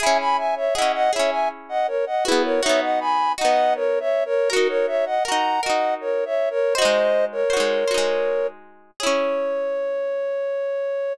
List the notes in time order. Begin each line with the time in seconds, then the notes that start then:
0.00 E4 G#4 E5 G#5
0.06 C#4
0.19 G#5 B5
0.37 E5 G#5
0.56 C#5 E5
0.74 G#4 D#5 F#5
0.78 C#4 E4
0.94 D#5 F#5
1.13 E4 G#4 C#5 E5
1.19 C#4
1.31 E5 G#5
1.69 D#5 F#5
1.87 A#4 C#5
2.06 D#5 F#5
2.25 E4 F#4 G#4 B4
2.32 B3
2.44 A#4 C#5
2.62 D#4 F#4 C#5 E5
2.69 B3
2.82 D#5 F#5
3.00 G#5 B5
3.38 D#4 F#4 D#5 F#5
3.45 B3
3.75 A#4 C#5
4.00 C#5 E5
4.25 A#4 C#5
4.50 F#4 A#4
4.56 D#4
4.69 A#4 C#5
4.87 C#5 E5
5.06 D#5 F#5
5.25 F#4 A#4 F#5 A#5
5.32 D#4
5.63 F#4 A#4 D#5 F#5
5.70 D#4
6.01 A#4 C#5
6.25 C#5 E5
6.50 A#4 C#5
6.75 F#4 C5 D#5
6.82 G#3 D#4
7.32 A#4 C#5
7.50 F#4 C5
7.57 G#3 D#4
7.88 F#4 C5
7.94 G#3 D#4
9.00 E4 G#4 C#5
9.07 C#4